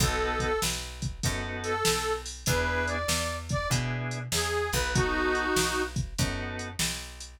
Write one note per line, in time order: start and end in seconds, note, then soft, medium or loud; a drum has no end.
0.00 0.58 B1 medium
0.00 0.51 B3 loud
0.00 0.51 D#4 loud
0.00 0.51 F#4 loud
0.00 0.39 A4 medium
0.00 0.51 A4 loud
0.00 kick loud
0.00 closed hi-hat loud
0.40 0.60 A4 medium
0.40 kick medium
0.40 closed hi-hat medium
0.62 1.20 B1 medium
0.62 snare loud
1.02 kick loud
1.02 closed hi-hat medium
1.23 1.83 F#2 medium
1.23 1.73 B3 medium
1.23 1.73 D#4 medium
1.23 1.73 F#4 medium
1.23 1.73 A4 medium
1.23 kick loud
1.23 closed hi-hat loud
1.64 2.13 A4 medium
1.64 closed hi-hat medium
1.85 2.45 B1 medium
1.85 snare loud
2.26 open hi-hat medium
2.46 3.05 E2 medium
2.46 2.97 B3 medium
2.46 2.97 D4 medium
2.46 2.97 E4 loud
2.46 2.97 G#4 medium
2.46 2.86 B4 medium
2.46 kick loud
2.46 closed hi-hat loud
2.87 3.35 D5 medium
2.87 closed hi-hat medium
3.08 3.66 E2 medium
3.08 snare loud
3.49 3.68 D5 medium
3.49 kick loud
3.49 closed hi-hat medium
3.70 4.28 B2 medium
3.70 4.19 B3 medium
3.70 4.19 D4 medium
3.70 4.19 E4 medium
3.70 4.19 G#4 medium
3.70 kick loud
3.70 closed hi-hat loud
4.11 closed hi-hat medium
4.32 4.70 E2 medium
4.32 4.70 G#4 medium
4.32 snare loud
4.72 5.52 B1 medium
4.72 4.91 B4 medium
4.72 kick medium
4.72 closed hi-hat medium
4.94 5.44 B3 medium
4.94 5.82 D#4 medium
4.94 5.44 D#4 loud
4.94 5.82 F#4 medium
4.94 5.44 F#4 loud
4.94 5.44 A4 medium
4.94 kick loud
4.94 closed hi-hat loud
5.35 closed hi-hat medium
5.56 6.14 B1 medium
5.56 snare loud
5.96 kick loud
5.96 closed hi-hat medium
6.18 6.76 F#2 medium
6.18 6.68 B3 medium
6.18 6.68 D#4 medium
6.18 6.68 F#4 medium
6.18 6.68 A4 medium
6.18 kick loud
6.18 closed hi-hat loud
6.59 closed hi-hat medium
6.79 7.37 B1 medium
6.79 snare loud
7.20 closed hi-hat medium